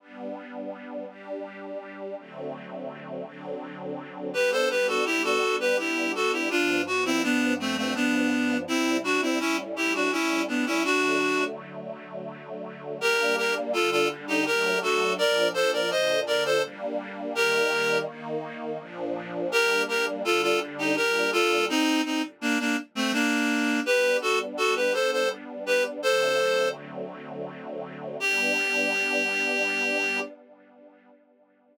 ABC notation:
X:1
M:3/4
L:1/16
Q:1/4=83
K:G
V:1 name="Clarinet"
z12 | z12 | [GB] [Ac] [GB] [FA] [EG] [FA]2 [GB] [EG]2 [FA] [EG] | [D=F]2 ^F [CE] [B,D]2 [A,C] [A,C] [B,D]4 |
[CE]2 [DF] [CE] [^CE] z [EG] [DF] [CE]2 [B,D] [CE] | [DF]4 z8 | [K:Gm] [GB]2 [GB] z [FA] [FA] z [EG] [GB]2 [^FA]2 | [Bd]2 [Ac] [Bd] [ce]2 [Bd] [Ac] z4 |
[GB]4 z8 | [GB]2 [GB] z [FA] [FA] z [EG] [GB]2 [FA]2 | [CE]2 [CE] z [B,D] [B,D] z [A,C] [B,D]4 | [K:G] [GB]2 [FA] z [FA] [GB] [Ac] [Ac] z2 [GB] z |
[Ac]4 z8 | G12 |]
V:2 name="String Ensemble 1"
[G,B,D]6 [G,DG]6 | [D,F,A,C]6 [D,F,CD]6 | [G,B,D]12 | [G,,=F,B,D]12 |
[C,G,E]4 [A,,G,^CE]8 | [D,F,A,]12 | [K:Gm] [G,B,D]4 [D,G,D]4 [^F,A,D]4 | [B,,F,D]4 [B,,D,D]4 [G,B,D]4 |
[E,G,B,]4 [E,B,E]4 [B,,F,D]4 | [G,B,D]4 [D,G,D]4 [B,,G,D]4 | z12 | [K:G] [G,B,D]12 |
[D,F,A,C]12 | [G,B,D]12 |]